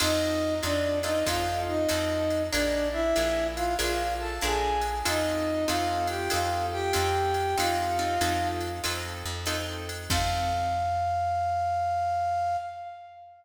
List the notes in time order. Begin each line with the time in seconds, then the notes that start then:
0.00 F2 C4 D#4 F4 A4 D#5, crash, ride
0.63 F2 C4 D4 D#4 F4 A4 D5, hi-hat pedal, ride
1.03 C4 D#4 F4 A4 D#5, ride
1.26 F2 C4 D#4 F4 A4 F5, kick, ride
1.67 D#4 D#5
1.89 F2 C4 D#4 F4 A4, hi-hat pedal, ride
2.30 ride
2.52 A#1 D4 F4 G#4 A#4 D5, ride
2.93 E4 E5
3.16 A#1 D4 F4 G#4 A#4, hi-hat pedal, ride
3.56 F4 F5, ride
3.79 A#1 D4 F4 G#4 A#4 F5, ride
4.20 A4 A5
4.41 A#1 D4 F4 G#4 A#4 G#5, hi-hat pedal
4.81 ride
5.05 F2 C4 D#4 F4 A4 D#5, ride
5.68 F2 C4 D#4 F4 A4 F5, hi-hat pedal, ride
6.07 G4 G5, ride
6.30 F2 C4 D#4 F4 A4 F5, ride
6.72 G4 G5
6.93 F2 C4 D#4 F4 A4, hi-hat pedal, ride
7.34 ride
7.58 F2 C4 D#4 F4 A4 F5, ride
7.99 C4 D#4 F4 A4
8.21 F2 C4 D#4 F4 A4, hi-hat pedal, ride
8.61 ride
8.84 F2 C4 D#4 F4 A4, ride
9.26 F2
9.46 C4 D#4 F4 A4, hi-hat pedal, ride
9.89 ride
10.10 F2 C4 D#4 F4 A4 F5, kick, crash